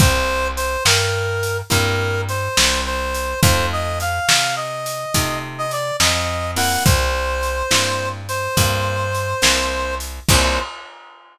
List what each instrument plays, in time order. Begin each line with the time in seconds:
0.00 electric bass (finger) C2, acoustic guitar (steel) A#3 C4 E4 G4, clarinet C5, kick, closed hi-hat
0.57 clarinet C5, closed hi-hat
0.85 electric bass (finger) G2, clarinet A#4, snare
1.43 closed hi-hat
1.70 electric bass (finger) G2, acoustic guitar (steel) A#3 C4 E4 G4, clarinet A#4, kick, closed hi-hat
2.29 clarinet C5, closed hi-hat
2.57 electric bass (finger) C2, snare
2.86 clarinet C5
3.14 closed hi-hat
3.42 electric bass (finger) F2, acoustic guitar (steel) A3 C4 D#4 F4, clarinet C5, kick, closed hi-hat
3.72 clarinet D#5
4.00 clarinet F5, closed hi-hat
4.28 electric bass (finger) C3, snare
4.56 clarinet D#5
4.86 closed hi-hat
5.14 electric bass (finger) C3, acoustic guitar (steel) A3 C4 D#4 F4, kick, closed hi-hat
5.58 clarinet D#5
5.71 clarinet D5, closed hi-hat
6.00 electric bass (finger) F2, clarinet D#5, snare
6.56 acoustic guitar (steel) A#3 C4 E4 G4, clarinet F#5, open hi-hat
6.85 electric bass (finger) C2, clarinet C5, kick, closed hi-hat
7.43 closed hi-hat
7.71 electric bass (finger) G2, acoustic guitar (steel) A#3 C4 E4 G4, snare
8.29 clarinet C5, closed hi-hat
8.57 electric bass (finger) G2, acoustic guitar (steel) A#3 C4 E4 G4, kick, closed hi-hat
9.15 closed hi-hat
9.42 electric bass (finger) C2, acoustic guitar (steel) A#3 C4 E4 G4, snare
10.00 closed hi-hat
10.29 electric bass (finger) C2, acoustic guitar (steel) A#3 C4 E4 G4, clarinet C5, kick, crash